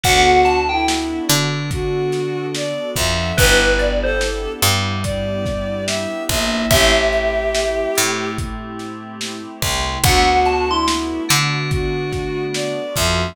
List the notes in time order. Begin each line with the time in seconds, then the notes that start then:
0.03 D2 B3 D4 F#4 A4 F#5, kick, closed hi-hat
0.45 A5, closed hi-hat
0.69 E4 G5
0.88 snare
1.29 D3 D4, closed hi-hat
1.71 F#4, kick, closed hi-hat
2.12 snare, closed hi-hat
2.55 D5, snare
2.96 F2 F3 E5, kick, closed hi-hat
3.37 G1 B3 D4 E4 G4 B4, kick, closed hi-hat
3.79 D5, closed hi-hat
4.03 A4 C5
4.21 snare
4.62 G2 G3, closed hi-hat
5.03 D5, kick, closed hi-hat
5.46 kick, snare, closed hi-hat
5.87 E5, snare
6.29 A#1 A#3 E5, kick, closed hi-hat
6.70 A1 A3 C4 E4 G4 E5, kick, closed hi-hat
7.12 closed hi-hat
7.55 snare
7.95 A2 A3, closed hi-hat
8.38 kick, closed hi-hat
8.79 snare, closed hi-hat
9.21 snare
9.62 C2 C3, kick, closed hi-hat
10.03 D2 A3 B3 D4 F#4 F#5, kick, closed hi-hat
10.45 A5, closed hi-hat
10.69 E4 C6
10.88 snare
11.29 D3 D4, closed hi-hat
11.71 F#4, kick, closed hi-hat
12.12 kick, snare, closed hi-hat
12.54 D5, snare
12.95 F2 F3 E5, kick, closed hi-hat